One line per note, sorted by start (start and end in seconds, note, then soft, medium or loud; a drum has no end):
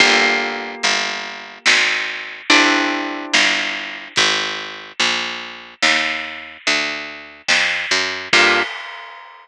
0.00 0.75 G1 loud
0.00 2.45 A#3 loud
0.00 2.45 F4 loud
0.00 2.45 G4 loud
0.00 2.45 A4 medium
0.00 kick loud
0.00 closed hi-hat medium
0.83 1.59 G1 medium
0.83 closed hi-hat medium
1.66 2.42 G#1 medium
1.66 snare loud
2.50 3.26 G1 medium
2.50 4.13 C4 loud
2.50 4.13 D4 loud
2.50 4.13 E4 medium
2.50 4.13 G4 medium
2.50 closed hi-hat medium
3.34 4.09 G1 medium
3.34 snare medium
4.16 4.92 G#1 loud
4.16 kick loud
4.16 closed hi-hat medium
4.99 5.74 A#1 medium
4.99 closed hi-hat medium
5.82 6.57 D#2 medium
5.82 snare medium
6.67 7.42 D2 medium
6.67 closed hi-hat medium
7.48 7.86 F2 medium
7.48 snare loud
7.91 8.28 F#2 medium
8.33 8.63 G2 loud
8.33 8.62 A#3 loud
8.33 8.62 F4 loud
8.33 8.62 G4 medium
8.33 8.62 A4 loud
8.33 kick loud
8.33 crash loud